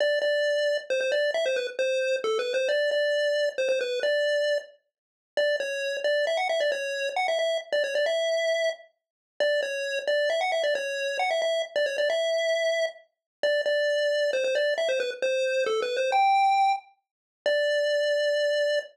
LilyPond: \new Staff { \time 3/4 \key d \dorian \tempo 4 = 134 d''8 d''4. c''16 c''16 d''8 | e''16 c''16 b'16 r16 c''4 \tuplet 3/2 { a'8 b'8 c''8 } | d''8 d''4. c''16 c''16 b'8 | d''4. r4. |
\key e \dorian d''8 cis''4 d''8 e''16 fis''16 e''16 d''16 | cis''4 fis''16 e''16 e''8 r16 d''16 cis''16 d''16 | e''4. r4. | d''8 cis''4 d''8 e''16 fis''16 e''16 d''16 |
cis''4 fis''16 e''16 e''8 r16 d''16 cis''16 d''16 | e''2 r4 | \key d \dorian d''8 d''4. c''16 c''16 d''8 | e''16 c''16 b'16 r16 c''4 \tuplet 3/2 { a'8 b'8 c''8 } |
g''4. r4. | d''2. | }